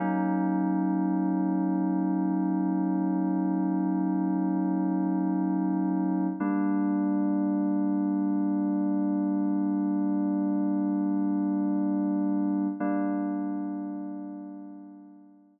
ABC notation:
X:1
M:4/4
L:1/8
Q:1/4=75
K:Gphr
V:1 name="Electric Piano 2"
[^F,^A,^C^D]8- | [^F,^A,^C^D]8 | [G,B,D]8- | [G,B,D]8 |
[G,B,D]8 |]